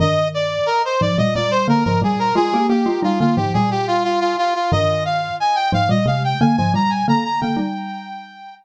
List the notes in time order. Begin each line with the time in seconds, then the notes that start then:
0.00 G2 D#3 D#5
0.34 D5
0.66 A#4
0.85 C5
1.01 G#2 F3 D5
1.18 A#2 G3 D#5
1.35 A#2 G3 D5
1.51 C5
1.68 D3 A#3 A#4
1.84 G#2 F3 A#4
2.02 A#2 G3 G#4
2.19 A#4
2.35 G#3 F4 G#4
2.54 A#3 G4
2.69 A#3 G4
2.86 G#3 F4
3.03 G3 D#4 F4
3.20 D3 A#3 F4
3.37 G#2 F3 G4
3.54 A#2 G3 G#4
3.71 G4
3.87 F4
4.04 F4
4.20 F4
4.38 F4
4.55 F4
4.72 G2 D#3 D#5
5.05 F5
5.40 G#5
5.55 G5
5.72 G#2 F3 F5
5.89 A#2 G3 D#5
6.06 C3 G#3 F5
6.24 G5
6.40 D3 A#3 G#5
6.57 G#2 F3 G#5
6.74 A#2 G3 A#5
6.90 G#5
7.08 D3 A#3 A#5
7.24 A#5
7.41 D3 A#3 G5
7.56 G3 D#4